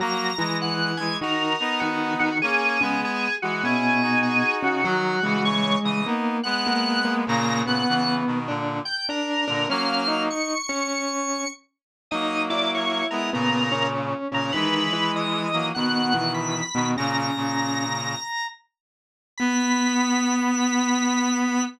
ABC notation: X:1
M:4/4
L:1/8
Q:"Swing" 1/4=99
K:B
V:1 name="Drawbar Organ"
a2 f g A2 F F | G2 G F G2 G F | F2 c d z f3 | a f2 z2 =g A2 |
^e2 c'4 z2 | d =d c A A2 z A | B2 d2 f2 b2 | a5 z3 |
b8 |]
V:2 name="Vibraphone"
[F,F] [E,E]3 [D,D] z [D,D] [D,D] | z [C,C] z2 [B,,B,]3 [C,C] | [F,F] [G,G]3 [A,A] z [A,A] [A,A] | [A,A] [B,B]3 [=D=d] z [Dd] [Dd] |
[Cc] [Dd]2 [Cc]3 z2 | [Dd] [Ee]3 [B,B] [Cc]2 [Cc] | [D,D] [E,E]3 [B,,B,] [E,E]2 [B,,B,] | [C,C]3 z5 |
B,8 |]
V:3 name="Clarinet"
[F,A,] [E,G,]2 [E,G,] [DF] [B,D]3 | [A,C] [G,B,]2 [E,G,] [CE] [DF]3 | [D,F,] [C,E,]2 [C,E,] [B,D] [G,B,]3 | [A,,C,] [A,,C,] [C,E,] [B,,D,] [A,,=D,] z2 [A,,D,] |
[F,A,]2 z6 | [F,A,]3 [G,B,] [A,,C,]3 [A,,C,] | [E,G,]3 [F,A,] [B,,D,]3 [B,,D,] | [A,,C,] [A,,C,]3 z4 |
B,8 |]